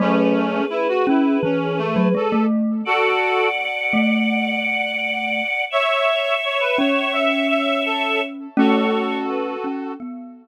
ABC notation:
X:1
M:4/4
L:1/16
Q:1/4=84
K:A
V:1 name="Choir Aahs"
[GB]16 | [df]16 | [ce]16 | [Ac]4 B2 A2 z8 |]
V:2 name="Clarinet"
[A,C]4 E F E2 C2 A,2 A2 z2 | [FA]4 z12 | [ce]4 c B c2 e2 e2 A2 z2 | [FA]8 z8 |]
V:3 name="Glockenspiel"
[F,A,]4 z2 C2 E,3 F, G, A,3 | z6 A,10 | z6 C10 | [A,C]6 C2 B,4 z4 |]